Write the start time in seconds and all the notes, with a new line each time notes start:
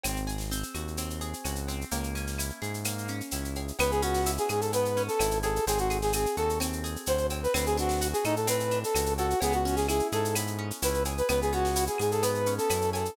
0.04 G#1 C4, cowbell, claves, shaker
0.16 shaker
0.27 G#4, shaker
0.38 snare, shaker
0.51 C4, shaker
0.63 shaker
0.75 D#2 F#4, claves, shaker
0.88 shaker
0.97 C4, cowbell, shaker
1.10 shaker
1.21 G#4, shaker
1.33 shaker
1.45 C#2 F#4, cowbell, claves, shaker
1.56 shaker
1.68 C4, cowbell, shaker
1.81 shaker
1.91 C#2 A#3, cowbell, shaker
2.04 shaker
2.15 C#4, shaker
2.27 snare, shaker
2.38 E4, claves, shaker
2.50 shaker
2.62 G#2 G#4, shaker
2.74 shaker
2.84 A#3, cowbell, claves, shaker
2.98 shaker
3.08 C#4, shaker
3.21 shaker
3.31 C#2 E4, cowbell, shaker
3.45 shaker
3.55 G#4, cowbell, shaker
3.68 shaker
3.79 C#2 B3 B4, cowbell, claves, shaker
3.91 G#4, shaker
4.02 C#4 F#4, shaker
4.14 snare, shaker
4.26 E4, shaker
4.38 G#4, shaker
4.49 G#2 G#4, claves, shaker
4.61 A4, shaker
4.73 B3 B4, cowbell, shaker
4.85 shaker
4.97 C#4, shaker
5.08 A4, shaker
5.19 G#1 E4, cowbell, claves, shaker
5.31 shaker
5.43 G#4 A4, cowbell, shaker
5.56 shaker
5.67 G#1 C4 G#4, cowbell, shaker
5.78 F#4, shaker
5.90 G#4, shaker
6.02 G#4, snare, shaker
6.13 C4 G#4, claves, shaker
6.26 shaker
6.37 D#2 F#4 A4, shaker
6.49 shaker
6.60 C4, cowbell, claves, shaker
6.73 shaker
6.84 G#4, shaker
6.96 shaker
7.06 D2 F#4 C5, cowbell, shaker
7.18 shaker
7.30 C4, cowbell, shaker
7.43 B4, shaker
7.54 D2 C4 B4, cowbell, claves, shaker
7.66 G#4, shaker
7.77 D4 F#4, shaker
7.89 snare, shaker
8.01 F#4, shaker
8.13 G#4, shaker
8.24 A2 D#4 A4, claves, shaker
8.36 A4, shaker
8.47 C4 B4, cowbell, shaker
8.60 shaker
8.71 D4, shaker
8.84 A4, shaker
8.95 C#2 F#4, cowbell, claves, shaker
9.06 shaker
9.18 F#4 A4, cowbell, shaker
9.30 shaker
9.41 C#2 B3 G#4, cowbell, shaker
9.52 F#4, shaker
9.65 C#4, shaker
9.76 G#4, snare, shaker
9.88 E4 G#4, claves, shaker
9.99 shaker
10.12 G#2 G#4 A4, shaker
10.25 shaker
10.35 B3, cowbell, claves, shaker
10.47 shaker
10.59 C#4
10.71 shaker
10.82 C#2 E4 B4, cowbell, shaker
10.94 shaker
11.05 G#4, cowbell, shaker
11.18 B4, shaker
11.29 C#2 B3 B4, cowbell, claves, shaker
11.42 G#4, shaker
11.52 C#4 F#4, shaker
11.65 snare, shaker
11.76 E4, shaker
11.87 G#4, shaker
11.98 G#2 G#4, claves, shaker
12.12 A4, shaker
12.22 B3 B4, cowbell, shaker
12.35 shaker
12.46 C#4, shaker
12.58 A4, shaker
12.70 F#2 E4, cowbell, claves, shaker
12.81 shaker
12.93 G#4 A4, cowbell, shaker
13.05 shaker